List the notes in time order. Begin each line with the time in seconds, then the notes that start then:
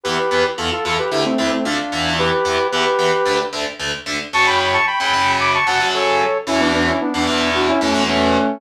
0.03 E2 E3 B3 G4 B4
0.31 E2 E3 B3
0.57 E2 E3 B3 F4 A4
0.72 F4 A4
0.85 E2 E3 B3 F4 A4
0.98 G4 B4
1.11 D2 D3 A3 E4 G4
1.25 A3 C4
1.38 D2 D3 A3 C4 E4
1.52 A3 C4
1.65 D2 D3 A3 D4 F4
1.92 E2 E3 B3
2.19 G4 B4
2.45 E2 E3 B3
2.72 E2 E3 B3 G4 B4
2.98 E2 E3 B3
3.25 D2 D3 A3
3.53 D2 D3 A3
3.79 D2 D3 A3
4.06 D2 D3 A3
4.33 F#2 C#3 F#3 A5 C#6
4.46 G5 B5
4.59 G5 B5
4.73 A5 C#6
4.86 G5 B5
5.00 F#2 C#3 F#3 G5 B5
5.13 F#2 C#3 F#3
5.40 B5 D6
5.54 A5 C#6
5.66 F#2 C#3 F#3 F#5 A5
5.80 F#2 C#3 F#3
5.94 A4 C#5
6.47 E2 B2 E3 C#4 E4
6.60 B3 D4
6.74 B3 D4
6.87 C#4 E4
7.01 B3 D4
7.14 E2 B2 E3 B3 D4
7.27 E2 B2 E3
7.54 D4 F#4
7.68 C#4 E4
7.81 E2 B2 E3 A3 C#4
7.94 E2 B2 E3
8.08 A3 C#4